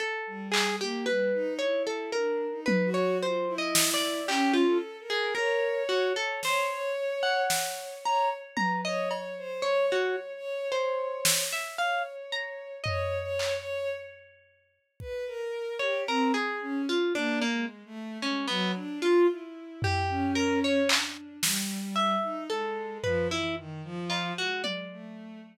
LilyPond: <<
  \new Staff \with { instrumentName = "Harpsichord" } { \time 3/4 \tempo 4 = 56 a'8 gis'16 g'16 b'8 cis''16 a'16 ais'8 b'16 cis''16 | \tuplet 3/2 { c''8 dis''8 d''8 } g'16 f'16 r16 gis'16 ais'8 fis'16 a'16 | c''8 r16 fis''8. ais''16 r16 ais''16 dis''16 r8 | cis''16 fis'16 r8 c''8. e''16 f''16 r16 ais''8 |
dis''8 r2 r16 cis''16 | ais'16 gis'8 f'16 d'16 ais16 r8 cis'16 b16 r16 f'16 | r8 g'8 ais'16 cis''16 r4 e''8 | a'8 b'16 e'16 r8 f'16 fis'16 d''4 | }
  \new Staff \with { instrumentName = "Violin" } { \time 3/4 r16 g8 ais16 g16 dis'16 e'8 \tuplet 3/2 { d'8 dis'8 fis'8 } | f'16 e'8. \tuplet 3/2 { cis'8 a'8 ais'8 } cis''8. cis''16 | cis''16 cis''8. cis''8 cis''16 r16 b'16 cis''16 cis''16 c''16 | \tuplet 3/2 { cis''8 cis''8 cis''8 } cis''8. r16 cis''4 |
\tuplet 3/2 { cis''8 cis''8 cis''8 } r4 b'16 ais'8 g'16 | c'16 gis'16 cis'16 r16 \tuplet 3/2 { ais8 gis8 a8 } gis16 fis16 d'16 f'16 | e'8. cis'8. d'8 g8. dis'16 | gis8 f16 e16 dis16 f8 gis8 a8 r16 | }
  \new DrumStaff \with { instrumentName = "Drums" } \drummode { \time 3/4 r8 hc8 r4 r8 tommh8 | r8 sn8 hc4 r4 | sn4 sn4 tommh8 cb8 | r4 r8 sn8 r4 |
tomfh8 hc8 r4 bd4 | r4 r4 r4 | r8 tomfh8 r8 hc8 sn4 | r8 tomfh8 r8 cb8 tommh4 | }
>>